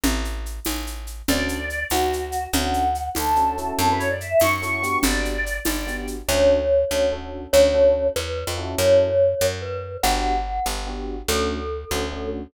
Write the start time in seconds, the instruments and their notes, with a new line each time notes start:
0.04 electric bass (finger) A1, low conga, shaker
0.25 shaker
0.46 shaker
0.65 electric bass (finger) A1, tambourine, high conga, shaker
0.87 shaker
1.07 shaker
1.28 electric bass (finger) D2, electric piano 1 C#4 D4 F#4 A4, choir aahs D5, low conga, shaker
1.49 shaker
1.70 shaker
1.90 electric bass (finger) D2, choir aahs F#4, tambourine, high conga, shaker
2.13 shaker
2.32 shaker
2.53 electric bass (finger) D2, electric piano 1 C#4 D4 F#4 A4, choir aahs F#5, low conga, shaker
2.74 shaker
2.95 shaker
3.15 electric bass (finger) D2, choir aahs A4, tambourine, high conga, shaker
3.36 electric piano 1 C#4 D4 F#4 A4, shaker
3.58 electric piano 1 C#4 E4 F#4 A4, shaker
3.78 electric bass (finger) F#2, choir aahs A4, low conga, shaker
3.89 choir aahs B4
3.99 choir aahs C#5, shaker
4.10 choir aahs D5
4.20 choir aahs E5, shaker
4.31 choir aahs E5
4.40 electric bass (finger) F#2, choir aahs C#6, tambourine, high conga, shaker
4.62 electric piano 1 C#4 E4 F#4 A4, shaker
4.83 electric piano 1 B3 D4 F#4 G4, shaker
5.03 electric bass (finger) G1, choir aahs D5, low conga, shaker
5.25 shaker
5.46 shaker
5.65 electric bass (finger) G1, choir aahs D5, tambourine, high conga, shaker
5.87 electric piano 1 B3 D4 F#4 G4, shaker
6.07 shaker
6.28 electric bass (finger) D2, electric piano 1 C#4 D4 F#4 A4, glockenspiel C#5
6.91 electric bass (finger) D2, electric piano 1 C#4 D4 F#4 A4
7.12 electric piano 1 C#4 D4 F#4 A4
7.53 electric bass (finger) D2, electric piano 1 C#4 D4 F#4 A4, glockenspiel C#5
7.74 electric piano 1 C#4 D4 F#4 A4
8.16 electric bass (finger) E2, glockenspiel B4
8.47 electric bass (finger) F2
8.58 electric piano 1 C#4 E4 F#4 A4
8.78 electric bass (finger) F#2, glockenspiel C#5
9.41 electric bass (finger) F#2
9.62 glockenspiel B4
10.03 electric bass (finger) G1, electric piano 1 B3 D4 F#4 G4, glockenspiel F#5
10.66 electric bass (finger) G1
10.87 electric piano 1 B3 D4 F#4 G4
11.28 electric bass (finger) D2, electric piano 1 A3 C#4 D4 F#4, glockenspiel A4
11.91 electric bass (finger) D2, electric piano 1 A3 C#4 D4 F#4
12.12 electric piano 1 A3 C#4 D4 F#4